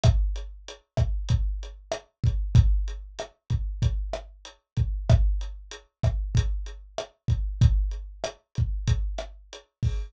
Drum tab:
HH |xxxxxxxx|xxxxxxxx|xxxxxxxx|xxxxxxxo|
SD |r--r--r-|--r--r--|r--r--r-|--r--r--|
BD |o--oo--o|o--oo--o|o--oo--o|o--oo--o|